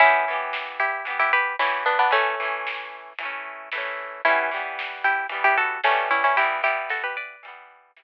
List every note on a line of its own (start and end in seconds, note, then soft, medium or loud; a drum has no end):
0.00 0.25 E3 loud
0.00 0.25 B3 loud
0.00 0.66 C#4 medium
0.00 0.66 E4 loud
0.00 kick loud
0.00 closed hi-hat medium
0.06 0.25 G4 loud
0.28 1.01 E3 loud
0.28 1.01 B3 loud
0.33 1.01 G4 loud
0.53 snare loud
0.80 1.05 E4 medium
0.80 1.05 G4 medium
1.05 1.54 E3 loud
1.05 1.54 B3 loud
1.05 closed hi-hat medium
1.10 1.54 G4 loud
1.20 1.32 E4 medium
1.20 1.32 G4 medium
1.33 1.56 G4 medium
1.33 1.56 B4 medium
1.59 2.08 E3 medium
1.59 2.08 B3 medium
1.59 1.84 C#4 medium
1.59 1.84 E4 medium
1.59 snare loud
1.64 2.08 G4 loud
1.86 1.98 B3 medium
1.86 1.98 D4 medium
1.99 2.12 B3 medium
1.99 2.12 D4 medium
2.11 2.35 E3 loud
2.11 3.12 A3 medium
2.11 2.35 A3 loud
2.11 3.12 C#4 medium
2.11 kick medium
2.11 closed hi-hat loud
2.16 2.35 C#4 loud
2.40 3.13 E3 loud
2.40 3.13 A3 loud
2.45 3.13 C#4 loud
2.67 snare loud
3.19 3.69 E3 medium
3.19 closed hi-hat loud
3.23 3.69 A3 loud
3.23 3.69 C#4 loud
3.72 4.21 E3 loud
3.72 4.21 A3 medium
3.72 snare loud
3.78 4.21 C#4 loud
4.25 4.50 E3 loud
4.25 4.50 G3 loud
4.25 4.96 C#4 medium
4.25 4.96 E4 medium
4.25 kick loud
4.25 closed hi-hat loud
4.30 4.50 B3 loud
4.51 5.25 E3 medium
4.51 5.25 G3 loud
4.56 5.25 B3 loud
4.79 snare loud
5.04 5.27 E4 medium
5.04 5.27 G4 medium
5.29 5.78 E3 medium
5.29 5.78 G3 loud
5.29 closed hi-hat medium
5.34 5.78 B3 loud
5.44 5.57 E4 medium
5.44 5.57 G4 medium
5.58 5.81 F#4 medium
5.58 5.81 A4 medium
5.84 6.34 E3 loud
5.84 6.34 G3 loud
5.84 6.09 A3 medium
5.84 6.09 C#4 medium
5.84 snare loud
5.90 6.34 B3 medium
6.11 6.23 C#4 medium
6.11 6.23 E4 medium
6.24 6.37 C#4 medium
6.24 6.37 E4 medium
6.36 6.62 E3 loud
6.36 6.61 E4 medium
6.36 6.61 G4 medium
6.36 kick medium
6.36 closed hi-hat loud
6.41 6.63 G3 loud
6.41 6.63 B3 loud
6.63 7.36 E3 medium
6.63 7.36 G3 loud
6.63 6.89 E4 medium
6.63 6.89 G4 medium
6.68 7.36 B3 medium
6.89 7.03 F#4 medium
6.89 7.03 A4 medium
6.89 snare medium
7.04 7.16 G4 medium
7.04 7.16 B4 medium
7.17 8.03 B4 medium
7.17 8.03 D5 medium
7.43 7.92 E3 medium
7.43 7.92 G3 loud
7.43 closed hi-hat loud
7.48 7.92 B3 loud
7.96 8.03 E3 loud
7.96 8.03 G3 loud
7.96 snare loud
8.02 8.03 B3 loud